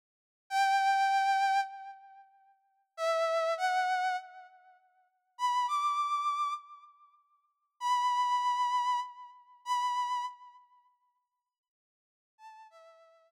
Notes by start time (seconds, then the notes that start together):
0.50 G5
2.97 E5
3.57 F#5
5.38 B5
5.68 D6
7.80 B5
9.65 B5
12.38 A5
12.70 E5